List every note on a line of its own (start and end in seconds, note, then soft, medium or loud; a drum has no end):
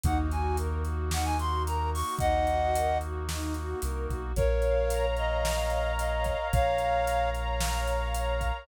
0.04 2.03 D#2 medium
0.04 4.32 A#3 medium
0.04 0.28 D#4 medium
0.04 4.32 D#4 medium
0.04 4.32 F#4 medium
0.04 0.18 F#5 medium
0.04 kick medium
0.04 closed hi-hat medium
0.32 0.56 F#4 medium
0.32 0.57 G#5 medium
0.32 closed hi-hat medium
0.57 0.81 A#4 medium
0.57 closed hi-hat medium
0.84 1.08 F#4 medium
0.84 closed hi-hat medium
1.11 1.35 D#4 medium
1.11 1.26 F#5 medium
1.11 snare medium
1.25 1.38 G#5 medium
1.39 1.64 F#4 medium
1.39 1.63 C6 medium
1.39 closed hi-hat medium
1.67 1.91 A#4 medium
1.67 1.90 A#5 medium
1.67 closed hi-hat medium
1.93 2.18 F#4 medium
1.93 2.15 C#6 medium
1.93 open hi-hat medium
2.19 3.75 D#2 medium
2.19 2.46 D#4 medium
2.19 2.98 D#5 medium
2.19 2.98 F#5 medium
2.19 kick medium
2.19 closed hi-hat medium
2.47 2.72 F#4 medium
2.47 closed hi-hat medium
2.75 2.99 A#4 medium
2.75 closed hi-hat loud
3.01 3.25 F#4 medium
3.01 closed hi-hat medium
3.29 3.53 D#4 medium
3.29 snare medium
3.54 3.79 F#4 medium
3.54 closed hi-hat medium
3.82 4.07 C2 medium
3.82 4.06 A#4 medium
3.82 closed hi-hat medium
4.10 4.34 B1 medium
4.10 4.34 F#4 medium
4.10 kick medium
4.10 closed hi-hat medium
4.36 6.35 A#1 medium
4.36 5.06 A#4 medium
4.36 8.65 A#4 medium
4.36 5.16 C#5 loud
4.36 5.06 C#5 medium
4.36 8.65 C#5 loud
4.36 8.65 F5 medium
4.36 kick medium
4.36 closed hi-hat medium
4.62 5.46 F5 medium
4.62 closed hi-hat medium
4.90 5.71 A#5 loud
4.90 closed hi-hat loud
5.17 5.99 C#5 medium
5.17 5.92 D#5 medium
5.17 closed hi-hat medium
5.45 6.25 F5 medium
5.45 snare medium
5.70 6.52 A#5 medium
5.70 closed hi-hat medium
5.98 6.79 C#5 medium
5.98 6.48 D#5 medium
5.98 closed hi-hat medium
6.24 7.07 F5 medium
6.24 kick medium
6.24 closed hi-hat medium
6.53 8.52 A#1 medium
6.53 7.30 C#5 medium
6.53 7.30 F5 medium
6.53 7.34 A#5 medium
6.53 kick loud
6.53 closed hi-hat medium
6.78 7.60 C#5 medium
6.78 closed hi-hat medium
7.07 7.86 F5 medium
7.07 closed hi-hat medium
7.35 8.14 A#5 medium
7.35 closed hi-hat medium
7.61 8.42 C#5 loud
7.61 snare loud
7.86 8.63 F5 medium
7.86 closed hi-hat medium
8.14 8.65 A#5 medium
8.14 closed hi-hat medium
8.41 8.67 C#5 medium
8.41 kick medium
8.41 closed hi-hat medium